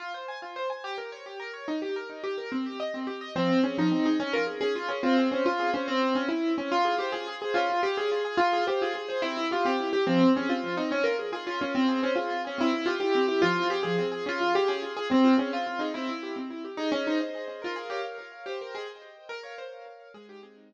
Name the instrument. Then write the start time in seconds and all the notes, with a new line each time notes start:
acoustic grand piano
0.00 F4
0.14 C5
0.28 G#5
0.42 F4
0.56 C5
0.70 G#5
0.84 G4
0.98 A#4
1.12 C#5
1.26 G4
1.40 A#4
1.54 C#5
1.68 D#4
1.82 G4
1.96 A#4
2.10 D#4
2.24 G4
2.38 A#4
2.52 C4
2.66 G4
2.80 D#5
2.94 C4
3.07 G4
3.21 D#5
3.36 F3 C4
3.49 C4
3.64 C#4 G#4
3.78 F3 D#4
3.91 C4
4.05 D#4 G#4
4.20 C#4
4.33 F4 A#4
4.47 G#4
4.61 C#4 G#4
4.75 F4
4.88 C#4 G#4
5.03 C4 F4
5.18 G#4
5.31 C#4 C5
5.46 F4
5.59 G#4
5.73 C#4 C5
5.88 C4
6.15 C#4
6.28 E4
6.58 C#4
6.72 F4
6.85 G#4
6.98 G4 C5
7.12 F4 G#4
7.28 G#4
7.42 G#4 C5
7.54 C#4 F4
7.70 F4
7.83 G4 G#4
7.97 C#4 G#4
8.12 F4
8.25 G#4
8.37 F4
8.53 G#4
8.67 G4 C5
8.82 F4 G#4
8.95 G#4
9.08 G#4 C5
9.22 C4 E4
9.37 E4
9.51 F4 G4
9.65 C4 G4
9.80 E4
9.93 G4
10.07 F3 C4
10.21 C4
10.35 C#4 G#4
10.49 C4 F4
10.64 F3
10.77 C4 D#4
10.91 C#4
11.04 F4 A#4
11.19 G#4
11.32 F4 G#4
11.46 C#4 F4
11.61 C#4 F4
11.75 C4
11.88 G#4
12.03 C#4 C5
12.15 F4 G#4
12.30 F4
12.45 C#4 G#4
12.58 C4 E4
12.73 E4
12.86 F4 G4
13.00 E4 G4
13.15 C4
13.28 E4 G4
13.42 F3 F4
13.57 C4
13.70 G4 G#4
13.83 F3 G#4
13.99 C4
14.12 G#4
14.26 C#4 F4
14.41 F4
14.54 G4 G#4
14.68 C#4 G#4
14.82 F4
14.97 G#4
15.11 C4
15.24 F4
15.38 C#4 G#4
15.52 C4 F4
15.67 F4
15.79 D#4 G#4
15.94 C4 E4
16.08 E4
16.23 G4
16.36 C4
16.50 E4
16.64 G4
16.77 D#4 G#4
16.92 C#4 D#5
17.06 D#4 C5
17.21 D#5
17.35 G#4
17.48 D#5
17.62 F4 A#4
17.76 G#4 F5
17.90 G4 C#5
18.04 F5
18.18 A#4
18.32 F5
18.46 G4 C5
18.60 A#4 G5
18.74 G#4 D#5
18.88 G5
19.02 C5
19.16 G5
19.29 A#4
19.43 C#5 F5
19.58 C5 C#5
19.73 F5
19.86 A#4
20.00 F5
20.14 G#3 G#4
20.28 D#4 G4
20.43 C4 G#4
20.56 D#4
20.69 G#3